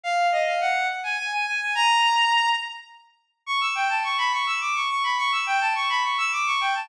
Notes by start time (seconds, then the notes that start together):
0.04 F5
0.32 D#5
0.46 F5
0.61 F#5
1.04 G#5
1.18 G#5
1.32 G#5
1.46 G#5
1.61 G#5
1.75 A#5
3.46 C#6
3.61 E6
3.75 G5
3.89 A5
4.04 C#6
4.18 B5
4.32 C#6
4.46 E6
4.61 D6
4.75 C#6
4.89 C#6
5.04 B5
5.18 C#6
5.32 E6
5.46 G5
5.61 A5
5.75 C#6
5.89 B5
6.04 C#6
6.18 E6
6.32 D6
6.46 C#6
6.61 G5
6.75 A5